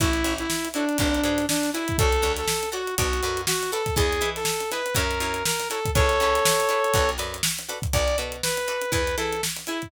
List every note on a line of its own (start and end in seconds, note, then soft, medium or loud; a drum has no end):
0.00 0.23 A1 medium
0.00 0.10 E4 medium
0.00 0.34 E4 medium
0.00 0.10 F#4 loud
0.00 0.10 A4 medium
0.00 0.10 C#5 medium
0.00 kick loud
0.00 closed hi-hat loud
0.13 closed hi-hat medium
0.24 0.47 A1 medium
0.24 0.43 E4 medium
0.24 0.43 F#4 medium
0.24 0.43 A4 medium
0.24 0.43 C#5 medium
0.24 closed hi-hat medium
0.38 0.68 E4 medium
0.38 closed hi-hat medium
0.50 snare loud
0.65 closed hi-hat medium
0.74 0.97 D4 medium
0.74 0.85 E4 medium
0.74 0.85 F#4 medium
0.74 0.85 A4 medium
0.74 0.85 C#5 medium
0.74 closed hi-hat medium
0.89 closed hi-hat medium
0.98 1.22 G#1 medium
0.98 1.46 D4 medium
0.98 1.09 F#4 medium
0.98 1.09 G#4 medium
0.98 1.09 B4 medium
0.98 1.09 D5 medium
0.98 kick loud
0.98 closed hi-hat loud
1.14 closed hi-hat medium
1.23 1.46 G#2 medium
1.23 1.43 F#4 medium
1.23 1.43 G#4 medium
1.23 1.43 B4 medium
1.23 1.43 D5 medium
1.23 closed hi-hat medium
1.38 snare soft
1.38 closed hi-hat medium
1.49 1.70 D4 medium
1.49 snare loud
1.63 snare medium
1.63 closed hi-hat medium
1.73 1.97 E4 medium
1.73 1.84 F#4 medium
1.73 1.84 G#4 medium
1.73 1.84 B4 medium
1.73 1.84 D5 medium
1.73 closed hi-hat medium
1.88 kick medium
1.88 closed hi-hat medium
1.98 2.22 D2 medium
1.98 2.10 F#4 loud
1.98 2.32 A4 loud
1.98 2.10 A4 medium
1.98 2.10 C#5 medium
1.98 2.10 D5 medium
1.98 kick loud
1.98 closed hi-hat loud
2.12 closed hi-hat medium
2.22 2.45 D2 medium
2.22 2.41 F#4 medium
2.22 2.41 A4 medium
2.22 2.41 C#5 medium
2.22 2.41 D5 medium
2.22 closed hi-hat medium
2.36 2.69 A4 medium
2.36 snare soft
2.36 closed hi-hat medium
2.48 snare loud
2.63 closed hi-hat medium
2.72 2.82 F#4 medium
2.72 2.95 F#4 medium
2.72 2.82 A4 medium
2.72 2.82 C#5 medium
2.72 2.82 D5 medium
2.72 closed hi-hat medium
2.87 closed hi-hat medium
2.98 3.21 B1 loud
2.98 3.41 F#4 medium
2.98 3.08 F#4 medium
2.98 3.08 A4 medium
2.98 3.08 B4 loud
2.98 3.08 D5 loud
2.98 kick medium
2.98 closed hi-hat loud
3.13 closed hi-hat medium
3.23 3.46 F#2 medium
3.23 3.42 F#4 medium
3.23 3.42 A4 medium
3.23 3.42 B4 medium
3.23 3.42 D5 medium
3.23 closed hi-hat medium
3.37 closed hi-hat medium
3.47 3.71 F#4 medium
3.47 snare loud
3.62 snare medium
3.62 closed hi-hat medium
3.72 3.82 F#4 medium
3.72 3.95 A4 medium
3.72 3.82 A4 medium
3.72 3.82 B4 medium
3.72 3.82 D5 medium
3.72 closed hi-hat medium
3.86 kick medium
3.86 snare soft
3.86 closed hi-hat medium
3.96 4.20 E2 medium
3.96 4.06 E4 medium
3.96 4.06 G#4 medium
3.96 4.30 G#4 medium
3.96 4.06 B4 medium
3.96 4.06 D#5 loud
3.96 kick loud
3.96 closed hi-hat loud
4.13 closed hi-hat medium
4.21 4.44 E3 medium
4.21 4.39 E4 medium
4.21 4.39 G#4 medium
4.21 4.39 B4 medium
4.21 4.39 D#5 medium
4.21 closed hi-hat medium
4.36 4.70 A4 medium
4.36 snare soft
4.36 closed hi-hat medium
4.45 snare loud
4.60 closed hi-hat medium
4.71 4.82 E4 medium
4.71 4.82 G#4 medium
4.71 4.94 B4 medium
4.71 4.82 B4 medium
4.71 4.82 D#5 medium
4.71 snare soft
4.71 closed hi-hat medium
4.86 closed hi-hat medium
4.95 5.19 F#2 loud
4.95 5.05 E4 medium
4.95 5.05 F#4 medium
4.95 5.05 A#4 medium
4.95 5.44 A#4 medium
4.95 5.05 C#5 loud
4.95 kick medium
4.95 closed hi-hat loud
5.11 closed hi-hat medium
5.20 5.43 F#2 medium
5.20 5.40 E4 medium
5.20 5.40 F#4 medium
5.20 5.40 A#4 medium
5.20 5.40 C#5 medium
5.20 closed hi-hat medium
5.34 closed hi-hat medium
5.45 5.68 A#4 medium
5.45 snare loud
5.60 snare medium
5.60 closed hi-hat medium
5.70 5.80 E4 medium
5.70 5.80 F#4 medium
5.70 5.91 A4 medium
5.70 5.80 A#4 medium
5.70 5.80 C#5 medium
5.70 closed hi-hat medium
5.85 kick medium
5.85 closed hi-hat medium
5.95 6.18 C#2 medium
5.95 6.06 E4 loud
5.95 6.06 G#4 loud
5.95 7.10 A4 medium
5.95 6.06 B4 medium
5.95 7.10 C#5 medium
5.95 6.06 C#5 loud
5.95 kick loud
5.95 closed hi-hat loud
6.09 closed hi-hat medium
6.20 6.43 C#2 medium
6.20 6.40 E4 medium
6.20 6.40 G#4 medium
6.20 6.40 B4 medium
6.20 6.40 C#5 medium
6.20 closed hi-hat medium
6.35 snare soft
6.35 closed hi-hat medium
6.45 snare loud
6.60 closed hi-hat medium
6.69 6.79 E4 medium
6.69 6.79 G#4 medium
6.69 6.79 B4 medium
6.69 6.79 C#5 medium
6.69 closed hi-hat medium
6.84 closed hi-hat medium
6.94 7.17 B1 medium
6.94 7.05 F#4 medium
6.94 7.05 A4 loud
6.94 7.05 B4 medium
6.94 7.05 D5 medium
6.94 kick loud
6.94 closed hi-hat loud
7.09 closed hi-hat medium
7.18 7.42 F#2 medium
7.18 7.36 F#4 medium
7.18 7.36 A4 medium
7.18 7.36 B4 medium
7.18 7.36 D5 medium
7.18 snare soft
7.18 closed hi-hat medium
7.34 closed hi-hat medium
7.43 snare loud
7.58 snare medium
7.58 closed hi-hat medium
7.69 7.79 F#4 medium
7.69 7.79 A4 medium
7.69 7.79 B4 medium
7.69 7.79 D5 medium
7.69 closed hi-hat medium
7.82 kick loud
7.82 closed hi-hat medium
7.93 8.16 B1 medium
7.93 8.05 F#4 medium
7.93 8.05 A4 loud
7.93 8.05 B4 medium
7.93 8.17 D5 medium
7.93 8.05 D5 medium
7.93 kick loud
7.93 closed hi-hat loud
8.08 closed hi-hat medium
8.18 8.42 B2 medium
8.18 8.37 F#4 medium
8.18 8.37 A4 medium
8.18 8.37 B4 medium
8.18 8.37 D5 medium
8.18 closed hi-hat medium
8.32 closed hi-hat medium
8.43 8.92 B4 medium
8.43 snare loud
8.57 closed hi-hat medium
8.68 8.78 F#4 medium
8.68 8.78 A4 medium
8.68 8.78 B4 medium
8.68 8.78 D5 medium
8.68 closed hi-hat medium
8.82 closed hi-hat medium
8.92 9.15 E2 medium
8.92 9.02 E4 loud
8.92 9.02 G#4 loud
8.92 9.16 B4 medium
8.92 9.02 B4 loud
8.92 kick medium
8.92 closed hi-hat loud
9.07 closed hi-hat medium
9.17 9.40 E3 medium
9.17 9.36 E4 medium
9.17 9.36 G#4 medium
9.17 9.42 A4 medium
9.17 9.36 B4 medium
9.17 snare soft
9.17 closed hi-hat medium
9.33 closed hi-hat medium
9.43 snare loud
9.56 snare medium
9.56 closed hi-hat medium
9.67 9.88 E4 medium
9.67 9.78 E4 medium
9.67 9.78 G#4 medium
9.67 9.78 B4 medium
9.67 closed hi-hat medium
9.82 kick medium
9.82 closed hi-hat medium